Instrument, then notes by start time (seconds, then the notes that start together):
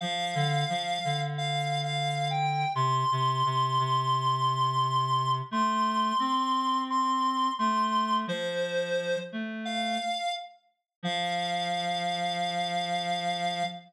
clarinet
0.01 F3 F5
0.35 D3
0.69 F3
1.04 D3
1.38 F5
1.83 F5
2.31 G5
2.75 C3 C6
3.11 C3
3.45 C3
3.79 C3
5.51 A3 C6
6.19 C4
6.90 C6
7.59 A3 C6
8.27 F3 C5
9.32 A3
9.65 F5
11.03 F3 F5